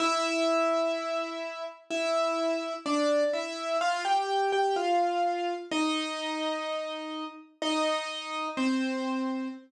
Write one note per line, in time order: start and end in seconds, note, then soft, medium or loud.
0.00 1.64 E4 medium
0.00 1.64 E5 medium
1.90 2.74 E4 medium
1.90 2.74 E5 medium
2.86 3.24 D4 medium
2.86 3.24 D5 medium
3.33 3.77 E4 medium
3.33 3.77 E5 medium
3.81 4.04 F4 medium
3.81 4.04 F5 medium
4.05 4.51 G4 medium
4.05 4.51 G5 medium
4.52 4.75 G4 medium
4.52 4.75 G5 medium
4.76 5.54 F4 medium
4.76 5.54 F5 medium
5.71 7.24 D#4 medium
5.71 7.24 D#5 medium
7.62 8.48 D#4 medium
7.62 8.48 D#5 medium
8.57 9.48 C4 medium
8.57 9.48 C5 medium